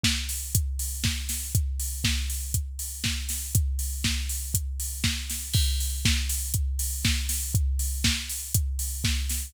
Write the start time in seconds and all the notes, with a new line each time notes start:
0.04 kick, snare
0.29 open hi-hat
0.55 kick, closed hi-hat
0.79 open hi-hat
1.04 kick, snare
1.29 snare, open hi-hat
1.55 kick, closed hi-hat
1.80 open hi-hat
2.04 kick, snare
2.30 open hi-hat
2.54 kick, closed hi-hat
2.79 open hi-hat
3.04 kick, snare
3.29 snare, open hi-hat
3.55 kick, closed hi-hat
3.79 open hi-hat
4.04 kick, snare
4.29 open hi-hat
4.54 kick, closed hi-hat
4.80 open hi-hat
5.04 kick, snare
5.30 snare, open hi-hat
5.54 kick, crash
5.80 open hi-hat
6.05 kick, snare
6.29 open hi-hat
6.54 kick, closed hi-hat
6.79 open hi-hat
7.05 kick, snare
7.29 snare, open hi-hat
7.55 kick, closed hi-hat
7.79 open hi-hat
8.04 kick, snare
8.29 open hi-hat
8.54 kick, closed hi-hat
8.79 open hi-hat
9.04 kick, snare
9.29 snare, open hi-hat